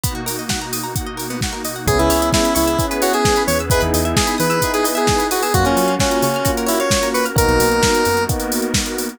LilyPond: <<
  \new Staff \with { instrumentName = "Lead 1 (square)" } { \time 4/4 \key cis \dorian \tempo 4 = 131 r1 | gis'16 e'8. e'8 e'8. r16 fis'16 gis'8. cis''16 r16 | b'16 r8. gis'8 b'8. gis'16 r16 gis'8. fis'16 gis'16 | fis'16 cis'8. cis'8 cis'8. r16 e'16 cis''8. b'16 r16 |
ais'2 r2 | }
  \new Staff \with { instrumentName = "Electric Piano 1" } { \time 4/4 \key cis \dorian r1 | <b cis' e' gis'>2 <b cis' e' gis'>2 | <b dis' e' gis'>2 <b dis' e' gis'>2 | <ais cis' eis' fis'>2 <ais cis' eis' fis'>2 |
<ais b dis' fis'>2 <ais b dis' fis'>2 | }
  \new Staff \with { instrumentName = "Pizzicato Strings" } { \time 4/4 \key cis \dorian b16 fis'16 ais'16 dis''16 fis''16 ais''16 dis'''16 ais''16 fis''16 dis''16 ais'16 b16 fis'16 ais'16 dis''16 fis''16 | gis'16 b'16 cis''16 e''16 gis''16 b''16 cis'''16 e'''16 gis'16 b'16 cis''16 e''16 gis''16 b''16 cis'''16 e'''16 | gis'16 b'16 dis''16 e''16 gis''16 b''16 dis'''16 e'''16 gis'16 b'16 dis''16 e''16 gis''16 b''16 dis'''16 e'''16 | fis'16 ais'16 cis''16 eis''16 fis''16 ais''16 cis'''16 eis'''16 fis'16 ais'16 cis''16 eis''16 fis''16 ais''16 cis'''16 eis'''16 |
r1 | }
  \new Staff \with { instrumentName = "Synth Bass 1" } { \clef bass \time 4/4 \key cis \dorian r1 | cis,16 cis,16 cis,4 cis,2 e,8~ | e,16 e,16 e,4 e2~ e8 | fis,16 fis,16 fis4 cis2~ cis8 |
b,,16 b,,16 b,,4 fis,2~ fis,8 | }
  \new Staff \with { instrumentName = "Pad 2 (warm)" } { \time 4/4 \key cis \dorian <b, ais dis' fis'>1 | <b cis' e' gis'>2 <b cis' gis' b'>2 | <b dis' e' gis'>2 <b dis' gis' b'>2 | <ais cis' eis' fis'>2 <ais cis' fis' ais'>2 |
<ais b dis' fis'>2 <ais b fis' ais'>2 | }
  \new DrumStaff \with { instrumentName = "Drums" } \drummode { \time 4/4 <hh bd>8 hho8 <bd sn>8 hho8 <hh bd>8 hho8 <bd sn>8 hho8 | <hh bd>16 hh16 hho16 hh16 <bd sn>16 hh16 hho16 hh16 <hh bd>16 hh16 hho16 hh16 <bd sn>16 hh16 hho16 hh16 | <hh bd>16 hh16 hho16 hh16 <bd sn>16 hh16 hho16 hh16 <hh bd>16 hh16 hho16 hh16 <bd sn>16 hh16 hho16 hho16 | <hh bd>16 hh16 hho16 hh16 <bd sn>16 hh16 hho16 hh16 <hh bd>16 hh16 hho16 hh16 <bd sn>16 hh16 hho16 hh16 |
<hh bd>16 hh16 hho16 hh16 <bd sn>16 hh16 hho16 hh16 <hh bd>16 hh16 hho16 hh16 <bd sn>16 hh16 hho16 hh16 | }
>>